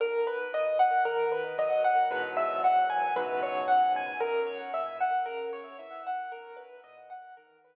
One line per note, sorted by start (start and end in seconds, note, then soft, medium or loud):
0.00 0.48 B1 medium
0.00 0.25 A#4 medium
0.27 0.51 B4 medium
0.53 1.00 A#2 medium
0.53 0.78 D#5 medium
0.79 1.04 F#5 medium
1.05 1.53 D#3 medium
1.05 1.29 A#4 medium
1.32 1.56 B4 medium
1.58 2.05 F#3 medium
1.58 1.83 D#5 medium
1.84 2.09 F#5 medium
2.11 3.05 E2 medium
2.11 3.05 G#2 medium
2.11 3.05 B2 medium
2.11 3.05 F#3 medium
2.11 2.35 B4 medium
2.37 2.61 E5 medium
2.64 2.88 F#5 medium
2.90 3.14 G#5 medium
3.16 4.11 C#2 medium
3.16 4.11 G#2 medium
3.16 4.11 B2 medium
3.16 4.11 F#3 medium
3.16 3.40 B4 medium
3.43 3.67 C#5 medium
3.68 3.92 F#5 medium
3.96 4.20 G#5 medium
4.20 4.68 F#2 medium
4.20 4.45 A#4 medium
4.46 4.71 C#5 medium
4.74 5.21 A#2 medium
4.74 4.98 E5 medium
5.00 5.25 F#5 medium
5.26 5.73 C#3 medium
5.26 5.50 A#4 medium
5.53 5.77 C#5 medium
5.79 6.26 E3 medium
5.79 6.03 E5 medium
6.07 6.31 F#5 medium
6.31 6.79 B1 medium
6.31 6.56 A#4 medium
6.57 6.81 B4 medium
6.84 7.31 A#2 medium
6.84 7.08 D#5 medium
7.10 7.34 F#5 medium
7.37 7.75 D#3 medium
7.37 7.61 A#4 medium
7.64 7.75 B4 medium